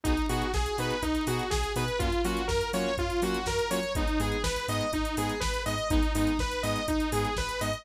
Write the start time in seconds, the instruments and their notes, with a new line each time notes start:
0.04 synth bass 2 B1, lead 2 (sawtooth) B3 D#4 F#4 G#4, kick, closed hi-hat
0.17 closed hi-hat
0.29 synth bass 2 B2, lead 2 (sawtooth) B3 D#4 F#4 G#4, open hi-hat
0.42 closed hi-hat
0.54 synth bass 2 B1, lead 2 (sawtooth) G#4, kick, snare
0.66 closed hi-hat
0.78 synth bass 2 B2, lead 2 (sawtooth) B3 D#4 F#4 G#4 B4, open hi-hat
0.90 closed hi-hat
1.02 synth bass 2 B1, lead 2 (sawtooth) D#4, kick, closed hi-hat
1.15 closed hi-hat
1.27 synth bass 2 B2, lead 2 (sawtooth) B3 D#4 F#4 G#4, open hi-hat
1.39 closed hi-hat
1.50 synth bass 2 B1, lead 2 (sawtooth) G#4, kick, snare
1.64 closed hi-hat
1.76 synth bass 2 B2, lead 2 (sawtooth) B3 D#4 F#4 G#4 B4, open hi-hat
1.88 closed hi-hat
1.99 synth bass 2 F#2, lead 2 (sawtooth) A#3 C#4 F4 F#4, kick, closed hi-hat
2.12 closed hi-hat
2.24 synth bass 2 F#3, lead 2 (sawtooth) A#3 C#4 F4 F#4, open hi-hat
2.37 closed hi-hat
2.47 synth bass 2 F#2, lead 2 (sawtooth) A#4, kick, snare
2.61 closed hi-hat
2.73 synth bass 2 F#3, lead 2 (sawtooth) A#3 C#4 F4 F#4 C#5, open hi-hat
2.98 synth bass 2 F#2, lead 2 (sawtooth) F4, kick, closed hi-hat
3.10 closed hi-hat
3.22 synth bass 2 F#3, lead 2 (sawtooth) A#3 C#4 F4 F#4, open hi-hat
3.34 closed hi-hat
3.46 synth bass 2 F#2, lead 2 (sawtooth) A#4, kick, snare
3.59 closed hi-hat
3.71 synth bass 2 F#3, lead 2 (sawtooth) A#3 C#4 F4 F#4 C#5, open hi-hat
3.83 closed hi-hat
3.95 synth bass 2 G#1, lead 2 (sawtooth) G#3 B3 D#4, kick, closed hi-hat
4.08 closed hi-hat
4.20 synth bass 2 G#2, lead 2 (sawtooth) G#3 B3 D#4 G#4, open hi-hat
4.32 closed hi-hat
4.43 synth bass 2 G#1, lead 2 (sawtooth) B4, kick, snare
4.56 closed hi-hat
4.68 synth bass 2 G#2, lead 2 (sawtooth) G#3 B3 D#4 D#5, open hi-hat
4.81 closed hi-hat
4.93 synth bass 2 G#1, lead 2 (sawtooth) D#4, kick, closed hi-hat
5.05 closed hi-hat
5.17 synth bass 2 G#2, lead 2 (sawtooth) G#3 B3 D#4 G#4, open hi-hat
5.29 closed hi-hat
5.40 synth bass 2 G#1, lead 2 (sawtooth) B4, kick, snare
5.54 closed hi-hat
5.66 synth bass 2 G#2, lead 2 (sawtooth) G#3 B3 D#4 D#5, open hi-hat
5.78 closed hi-hat
5.90 synth bass 2 G#1, lead 2 (sawtooth) G#3 B3 D#4, kick, closed hi-hat
6.03 closed hi-hat
6.15 synth bass 2 G#2, lead 2 (sawtooth) G#3 B3 D#4, open hi-hat
6.27 closed hi-hat
6.39 synth bass 2 G#1, lead 2 (sawtooth) B4, kick, snare
6.51 closed hi-hat
6.63 synth bass 2 G#2, lead 2 (sawtooth) G#3 B3 D#4 D#5, open hi-hat
6.76 closed hi-hat
6.88 synth bass 2 G#1, lead 2 (sawtooth) D#4, kick, closed hi-hat
7.00 closed hi-hat
7.12 synth bass 2 G#2, lead 2 (sawtooth) G#3 B3 D#4 G#4, open hi-hat
7.25 closed hi-hat
7.37 synth bass 2 G#1, lead 2 (sawtooth) B4, kick, snare
7.49 closed hi-hat
7.61 synth bass 2 G#2, lead 2 (sawtooth) G#3 B3 D#4 D#5, open hi-hat
7.73 closed hi-hat